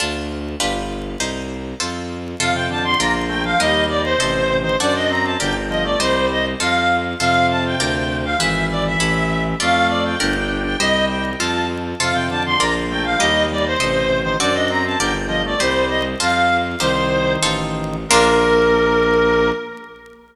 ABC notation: X:1
M:2/2
L:1/8
Q:1/2=100
K:Bb
V:1 name="Clarinet"
z8 | z8 | f g a c' b z g f | e2 d c4 c |
d e b a g z e d | c2 e z f3 z | f2 a g4 f | =e2 d e4 z |
f2 d g4 g | e2 g z a2 z2 | f g a c' b z g f | e2 d c4 c |
d e b a g z e d | c2 e z f3 z | "^rit." c4 z4 | B8 |]
V:2 name="Drawbar Organ"
z8 | z8 | C, C, D, D, B, z A, F, | G,2 G, z C,2 C, E, |
D D C C D, z F, A, | G,3 z5 | C,8 | =E,8 |
A,4 D D2 D | G,4 F2 z2 | C, C, D, D, B, z A, F, | G,2 G, z C,2 C, E, |
D D C C D, z F, A, | G,3 z5 | "^rit." E,8 | B,8 |]
V:3 name="Harpsichord"
[DFA]4 [DFG=B]4 | [EGc]4 [FAc]4 | [FAc]4 [FBd]4 | [GBe]4 [Ace]4 |
[^FAd]4 [GBd]4 | [Gce]4 [FAc]4 | [FAc]4 [FBd]4 | [=E^G=B]4 [EA^c]4 |
[FAd]4 [GBd]4 | [Gce]4 [FAc]4 | [FAc]4 [FBd]4 | [GBe]4 [Ace]4 |
[^FAd]4 [GBd]4 | [Gce]4 [FAc]4 | "^rit." [EGc]4 [EFAc]4 | [B,DF]8 |]
V:4 name="Violin" clef=bass
D,,4 G,,,4 | C,,4 F,,4 | F,,4 B,,,4 | E,,4 A,,,4 |
^F,,4 G,,,4 | C,,4 F,,4 | F,,4 D,,4 | ^G,,,4 A,,,4 |
F,,4 G,,,4 | C,,4 F,,4 | F,,4 B,,,4 | E,,4 A,,,4 |
^F,,4 G,,,4 | C,,4 F,,4 | "^rit." C,,4 A,,,4 | B,,,8 |]